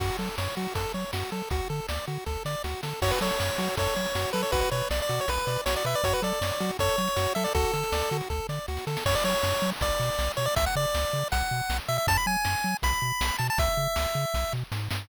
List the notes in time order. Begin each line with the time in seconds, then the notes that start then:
0.00 F#2 F#4, kick, crash
0.19 F#3 A4
0.38 F#2 C#5, snare
0.57 F#3 F#4
0.75 F#2 A4, kick, closed hi-hat
0.94 F#3 C#5
1.13 F#2 F#4, snare
1.32 F#3 A4, snare
1.50 D2 F#4, kick, closed hi-hat
1.70 D3 A4
1.89 D2 D5, snare
2.07 D3 F#4
2.26 D2 A4, kick, snare
2.45 D3 D5, snare
2.64 D2 F#4, snare
2.83 D3 A4, snare
3.02 F#2 F#4 C#5, kick, crash
3.11 B4, closed hi-hat
3.21 F#3 A4 C#5, closed hi-hat
3.30 closed hi-hat
3.40 F#2 C#5, snare
3.49 closed hi-hat
3.58 F#3 F#4, closed hi-hat
3.68 closed hi-hat
3.77 F#2 A4 C#5, kick, closed hi-hat
3.86 closed hi-hat
3.96 F#3 C#5, closed hi-hat
4.05 closed hi-hat
4.15 F#2 F#4, snare
4.25 closed hi-hat
4.33 F#3 A4 B4, snare, closed hi-hat
4.43 C#5, closed hi-hat
4.52 B1 F#4 B4, kick, closed hi-hat
4.61 B4, closed hi-hat
4.71 B2 B4 C#5, closed hi-hat
4.81 closed hi-hat
4.90 B1 D5, snare
5.00 D5, closed hi-hat
5.09 B2 F#4, closed hi-hat
5.19 C#5, closed hi-hat
5.28 B1 B4, kick, closed hi-hat
5.38 closed hi-hat
5.47 B2 D5, closed hi-hat
5.56 closed hi-hat
5.66 B1 F#4 C#5, snare
5.75 D5, closed hi-hat
5.84 B2 B4 E5, snare, closed hi-hat
5.94 D5, closed hi-hat
6.04 F#2 F#4 C#5, kick, closed hi-hat
6.13 B4, closed hi-hat
6.22 F#3 A4 D5, closed hi-hat
6.32 closed hi-hat
6.41 F#2 C#5, snare
6.51 closed hi-hat
6.60 F#3 F#4, closed hi-hat
6.69 closed hi-hat
6.79 F#2 A4 C#5, kick, closed hi-hat
6.89 closed hi-hat
6.98 F#3 C#5, closed hi-hat
7.07 closed hi-hat
7.16 F#2 F#4, snare
7.26 closed hi-hat
7.35 F#3 A4 E5, snare, closed hi-hat
7.44 D5, open hi-hat
7.54 D2 F#4 A4, kick, closed hi-hat
7.64 closed hi-hat
7.73 D3 A4, closed hi-hat
7.83 closed hi-hat
7.92 D2 D5, snare
8.02 closed hi-hat
8.11 D3 F#4, closed hi-hat
8.21 closed hi-hat
8.30 D2 A4, kick, snare
8.49 D3 D5, snare
8.68 D2 F#4, snare
8.77 snare
8.87 D3 A4, snare
8.97 snare
9.06 F#2 C#5, kick, crash
9.15 D5
9.24 F#3 C#5
9.43 F#2, snare
9.62 F#3
9.81 B1 D5, kick, closed hi-hat
10.00 B2
10.19 B1, snare
10.37 B2 C#5, snare
10.46 D5
10.56 C#2 E5, kick, closed hi-hat
10.66 F#5
10.76 C#3 D5
10.94 C#2, snare
11.13 C#3
11.32 B1 F#5, kick, closed hi-hat
11.51 B2
11.70 B1, snare
11.88 B2 E5, snare
11.98 E5
12.07 F#2 A5, kick, closed hi-hat
12.17 B5
12.26 F#3 G#5
12.45 F#2, snare
12.64 F#3
12.82 B1 B5, kick, closed hi-hat
13.02 B2
13.21 B1, snare
13.39 B2 A5, snare
13.50 A5
13.58 C#2 E5, kick, closed hi-hat
13.77 C#3
13.96 C#2, snare
14.15 C#3
14.34 B1, kick, snare
14.52 B2, snare
14.72 G#2, snare
14.91 G2, snare